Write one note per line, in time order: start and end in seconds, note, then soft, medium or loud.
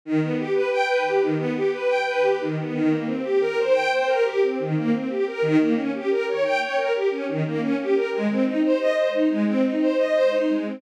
0.05 0.21 D#3 medium
0.22 0.37 B3 medium
0.39 0.54 G4 medium
0.55 0.70 B4 medium
0.72 0.87 G5 medium
0.88 1.03 B4 medium
1.05 1.20 G4 medium
1.21 1.36 D#3 medium
1.37 1.53 B3 medium
1.56 1.71 G4 medium
1.73 1.88 B4 medium
1.88 2.03 G5 medium
2.06 2.21 B4 medium
2.22 2.37 G4 medium
2.40 2.56 D#3 medium
2.58 2.73 B3 medium
2.73 2.88 D#3 medium
2.89 3.04 A#3 medium
3.06 3.21 C4 medium
3.23 3.38 G4 medium
3.41 3.56 A#4 medium
3.58 3.73 C5 medium
3.72 3.88 G5 medium
3.91 4.06 C5 medium
4.07 4.22 A#4 medium
4.24 4.39 G4 medium
4.43 4.58 C4 medium
4.59 4.74 D#3 medium
4.75 4.90 A#3 medium
4.93 5.08 C4 medium
5.09 5.24 G4 medium
5.27 5.42 A#4 medium
5.42 5.57 D#3 medium
5.59 5.74 A#3 medium
5.76 5.91 C#4 medium
5.94 6.09 G4 medium
6.10 6.25 A#4 medium
6.28 6.43 C#5 medium
6.44 6.59 G5 medium
6.61 6.76 C#5 medium
6.77 6.92 A#4 medium
6.94 7.09 G4 medium
7.11 7.26 C#4 medium
7.28 7.43 D#3 medium
7.46 7.61 A#3 medium
7.61 7.76 C#4 medium
7.80 7.95 G4 medium
7.95 8.10 A#4 medium
8.12 8.28 G#3 medium
8.29 8.45 C4 medium
8.46 8.61 D#4 medium
8.64 8.79 C5 medium
8.80 8.95 D#5 medium
8.96 9.12 C5 medium
9.14 9.29 D#4 medium
9.30 9.45 G#3 medium
9.47 9.62 C4 medium
9.65 9.80 D#4 medium
9.81 9.96 C5 medium
9.98 10.13 D#5 medium
10.14 10.30 C5 medium
10.31 10.46 D#4 medium
10.50 10.65 G#3 medium
10.66 10.81 C4 medium